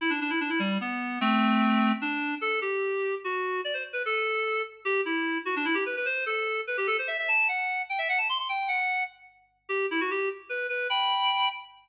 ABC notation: X:1
M:6/8
L:1/16
Q:3/8=99
K:Em
V:1 name="Clarinet"
E D D E D E G,2 B,4 | [A,C]8 D4 | A2 G6 F4 | d c z B A6 z2 |
[K:G] G2 E4 F D E G B B | c2 A4 B G A c e e | a2 f4 g e f a c' c' | g2 f4 z6 |
[K:Em] G2 E F G2 z2 B2 B2 | [gb]6 z6 |]